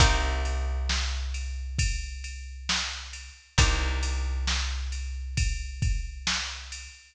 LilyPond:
<<
  \new Staff \with { instrumentName = "Acoustic Guitar (steel)" } { \time 4/4 \key c \minor \tempo 4 = 67 <bes c' ees' g'>1 | <bes c' ees' g'>1 | }
  \new Staff \with { instrumentName = "Electric Bass (finger)" } { \clef bass \time 4/4 \key c \minor c,1 | c,1 | }
  \new DrumStaff \with { instrumentName = "Drums" } \drummode { \time 4/4 <bd cymr>8 cymr8 sn8 cymr8 <bd cymr>8 cymr8 sn8 cymr8 | <bd cymr>8 cymr8 sn8 cymr8 <bd cymr>8 <bd cymr>8 sn8 cymr8 | }
>>